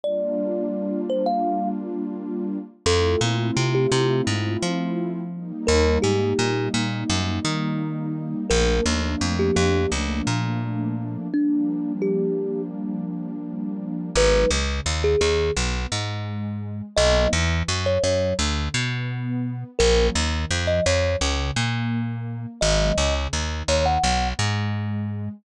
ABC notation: X:1
M:4/4
L:1/16
Q:1/4=85
K:Gm
V:1 name="Kalimba"
d6 c f3 z6 | A2 z3 G G2 z8 | B2 G4 z10 | B2 z3 G G2 z8 |
D4 G4 z8 | [K:G#m] B2 z3 G G2 z8 | d2 z3 c c2 z8 | A2 z3 d c2 z8 |
d3 z3 c f3 z6 |]
V:2 name="Pad 2 (warm)"
[G,B,DF]16 | [A,C=EF]14 [G,B,_E]2- | [G,B,E]16 | [F,A,B,D]16 |
[F,G,B,D]16 | [K:G#m] [F,G,B,D]2 C,2 D,2 D,2 B,2 G,6 | [F,A,B,D]2 E,2 F,2 F,2 =D,2 B,6 | [^E,F,A,C]2 D,2 E,2 E,2 C,2 A,6 |
[D,F,G,B,]2 C,2 D,2 D,2 B,2 G,6 |]
V:3 name="Electric Bass (finger)" clef=bass
z16 | F,,2 B,,2 C,2 C,2 _A,,2 F,6 | E,,2 _A,,2 B,,2 B,,2 ^F,,2 E,6 | B,,,2 E,,2 F,,2 F,,2 _D,,2 B,,6 |
z16 | [K:G#m] G,,,2 C,,2 D,,2 D,,2 B,,,2 G,,6 | B,,,2 E,,2 F,,2 F,,2 =D,,2 B,,6 | A,,,2 D,,2 ^E,,2 E,,2 C,,2 A,,6 |
G,,,2 C,,2 D,,2 D,,2 B,,,2 G,,6 |]